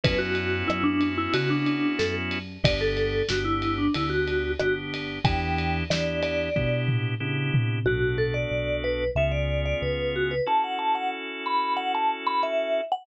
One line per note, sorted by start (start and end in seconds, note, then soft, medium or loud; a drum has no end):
0.04 0.63 F#2 medium
0.04 2.38 B3 loud
0.04 2.38 C#4 loud
0.04 2.38 E4 loud
0.04 2.38 F#4 loud
0.04 0.20 B4 medium
0.04 kick medium
0.04 ride loud
0.18 0.63 F#4 medium
0.35 ride medium
0.68 1.28 F#2 medium
0.68 0.83 E4 medium
0.68 cross-stick loud
0.84 1.11 D4 medium
1.01 ride medium
1.18 1.33 E4 medium
1.34 1.93 C#3 medium
1.34 1.50 F#4 medium
1.34 ride loud
1.50 1.95 D4 medium
1.66 ride medium
1.99 2.58 F#2 medium
1.99 2.14 A4 medium
1.99 snare medium
2.31 ride medium
2.64 3.22 G1 medium
2.64 3.23 B3 loud
2.64 3.23 D4 medium
2.64 3.23 G4 loud
2.64 2.80 D5 medium
2.64 kick loud
2.64 ride loud
2.81 3.27 A4 medium
2.97 ride medium
3.29 3.89 G1 medium
3.29 3.88 B3 medium
3.29 3.88 D4 medium
3.29 3.46 F#4 medium
3.29 3.88 G4 medium
3.29 snare loud
3.45 3.76 E4 medium
3.62 ride medium
3.78 3.94 D4 medium
3.94 4.54 D2 medium
3.94 4.54 B3 medium
3.94 4.54 D4 medium
3.94 4.11 E4 medium
3.94 4.54 G4 medium
3.94 ride medium
4.10 4.52 F#4 medium
4.28 ride medium
4.60 5.19 G1 medium
4.60 5.19 B3 medium
4.60 5.19 D4 medium
4.60 4.75 F#4 medium
4.60 5.19 G4 medium
4.60 cross-stick loud
4.94 ride medium
5.25 5.83 E2 medium
5.25 5.84 B3 medium
5.25 5.84 D4 loud
5.25 5.84 E4 loud
5.25 5.84 G4 loud
5.25 5.77 G5 medium
5.25 kick loud
5.25 ride medium
5.58 ride medium
5.90 6.49 E2 medium
5.90 6.49 B3 medium
5.90 6.49 D4 medium
5.90 6.49 E4 medium
5.90 6.49 G4 medium
5.90 6.20 D5 medium
5.90 snare loud
6.23 6.80 D5 medium
6.23 ride medium
6.56 7.15 B2 medium
6.56 7.15 B3 medium
6.56 7.15 D4 medium
6.56 7.15 E4 medium
6.56 7.15 G4 medium
6.56 kick medium
6.88 floor tom medium
7.20 7.50 C#3 medium
7.20 7.79 B3 medium
7.20 7.79 D4 medium
7.20 7.79 E4 loud
7.20 7.79 G4 medium
7.54 7.84 C3 medium
7.54 floor tom loud
7.86 8.45 B1 medium
7.86 9.04 B3 medium
7.86 9.04 D4 medium
7.86 8.16 F#4 medium
7.86 9.04 F#4 medium
7.86 9.04 A4 medium
8.18 8.34 A4 medium
8.34 8.76 D5 medium
8.51 9.10 B1 medium
8.84 9.11 B4 medium
9.15 9.74 C#2 medium
9.15 10.35 B3 medium
9.15 10.35 C#4 medium
9.15 10.35 F4 medium
9.15 10.35 G#4 medium
9.15 9.32 E5 medium
9.32 9.61 D5 medium
9.65 9.81 D5 medium
9.82 10.40 C#2 medium
9.82 10.14 B4 medium
10.16 10.31 F#4 medium
10.31 10.47 B4 medium
10.46 12.81 C#4 medium
10.46 12.81 E4 medium
10.46 12.81 F#4 medium
10.46 12.81 A4 medium
10.46 10.63 A5 medium
10.64 10.79 F#5 medium
10.79 10.94 A5 medium
10.95 11.11 F#5 medium
11.46 11.74 B5 medium
11.77 11.92 F#5 medium
11.95 12.10 A5 medium
12.27 12.42 B5 medium
12.43 12.84 E5 medium
12.92 13.06 F#5 medium